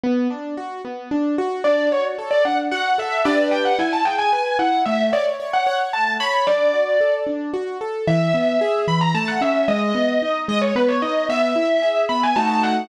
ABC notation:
X:1
M:3/4
L:1/16
Q:1/4=112
K:D
V:1 name="Acoustic Grand Piano"
z12 | d2 c z2 d f z f2 e2 | d2 g f ^g a =g ^g g2 f2 | e2 d z2 f f z a2 b2 |
d6 z6 | [K:E] e6 b _b a f e2 | d6 d c B c d2 | e6 b g a a f2 |]
V:2 name="Acoustic Grand Piano"
B,2 D2 F2 B,2 D2 F2 | D2 F2 A2 D2 F2 A2 | [DGB]4 E2 ^G2 B2 E2 | A,2 c2 c2 c2 A,2 c2 |
D2 F2 A2 D2 F2 A2 | [K:E] E,2 B,2 G2 E,2 A,2 C2 | G,2 B,2 D2 G,2 B,2 D2 | B,2 E2 G2 B,2 [A,DF]4 |]